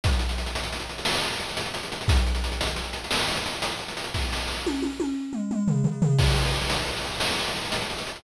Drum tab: CC |------------------------|------------------------|------------------------|x-----------------------|
HH |xxxxxxxxxxxx-xxxxxxxxxxx|xxxxxxxxxxxx-xxxxxxxxxxx|------------------------|-xxxxxxxxxxx-xxxxxxxxxxx|
SD |------------o-----------|------------o-----------|o-o-o-------------------|------------o-----------|
T1 |------------------------|------------------------|------o-o-o-------------|------------------------|
T2 |------------------------|------------------------|--------------o-o-------|------------------------|
FT |------------------------|------------------------|------------------o-o-o-|------------------------|
BD |o-----------------------|o-----------------------|o-----------------------|o-----------------------|